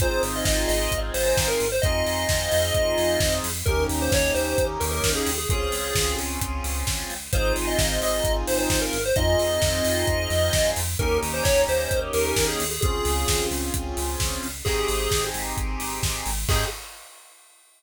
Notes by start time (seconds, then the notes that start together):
0.00 G#1 C4 D#4 F4 G#4 C5, kick, closed hi-hat
0.23 G#1, open hi-hat
0.36 D#5
0.45 G#1 D#5, kick, snare
0.68 G#1 D#5, open hi-hat
0.92 G#1, kick, closed hi-hat
1.14 G#1 C5, open hi-hat
1.26 C5
1.37 G#1, kick, snare
1.48 A#4
1.60 G#1, open hi-hat
1.72 C5
1.82 F2 C4 D#4 F4 G#4 D#5, kick, closed hi-hat
2.06 F2, open hi-hat
2.29 F2, kick, snare
2.52 F2, open hi-hat
2.74 F2, kick, closed hi-hat
2.98 F2, open hi-hat
3.20 F2, kick, snare
3.44 F2, open hi-hat
3.66 D#2 A#3 C#4 D#4 G4 A#4, kick, closed hi-hat
3.89 D#2, open hi-hat
4.02 C5
4.12 D#2 C#5, kick, snare
4.34 D#2 C5, open hi-hat
4.58 D#2, kick, closed hi-hat
4.80 D#2 A#4, open hi-hat
4.92 A#4
5.04 D#2, kick, snare
5.15 G#4
5.27 D#2, open hi-hat
5.38 G#4
5.49 C#2 C4 C#4 F4 G#4, kick, closed hi-hat
5.72 C#2, open hi-hat
5.95 C#2, kick, snare
6.18 C#2, open hi-hat
6.41 C#2, kick, closed hi-hat
6.64 C#2, open hi-hat
6.87 C#2, kick, snare
7.10 C#2, open hi-hat
7.32 G#1 C4 D#4 F4 G#4 C5, kick, closed hi-hat
7.56 G#1, open hi-hat
7.67 D#5
7.79 G#1 D#5, kick, snare
8.02 G#1 D#5, open hi-hat
8.24 G#1, kick, closed hi-hat
8.47 G#1 C5, open hi-hat
8.58 C5
8.70 G#1, kick, snare
8.82 A#4
8.93 G#1, open hi-hat
9.06 C5
9.16 F2 C4 D#4 F4 G#4 D#5, kick, closed hi-hat
9.39 F2, open hi-hat
9.62 F2, kick, snare
9.85 F2, open hi-hat
10.07 F2, kick, closed hi-hat
10.30 F2, open hi-hat
10.53 F2, kick, snare
10.76 F2, open hi-hat
10.99 D#2 A#3 C#4 D#4 G4 A#4, kick, closed hi-hat
11.22 D#2, open hi-hat
11.34 C5
11.44 D#2 C#5, kick, snare
11.68 D#2 C5, open hi-hat
11.91 D#2, kick, closed hi-hat
12.13 D#2 A#4, open hi-hat
12.26 A#4
12.36 D#2, kick, snare
12.48 G#4
12.60 D#2, open hi-hat
12.71 G#4
12.81 C#2 C4 C#4 F4 G#4, kick, closed hi-hat
13.05 C#2, open hi-hat
13.28 C#2, kick, snare
13.51 C#2, open hi-hat
13.74 C#2, kick, closed hi-hat
13.97 C#2, open hi-hat
14.20 C#2, kick, snare
14.43 C#2, open hi-hat
14.65 G#1 C4 D#4 G4 G#4, kick, crash
14.88 G#1, open hi-hat
15.11 G#1, kick, snare
15.34 G#1, open hi-hat
15.57 G#1, kick, closed hi-hat
15.80 G#1, open hi-hat
16.03 G#1, kick, snare
16.26 G#1, open hi-hat
16.49 G#2 C4 D#4 G4 G#4, kick, crash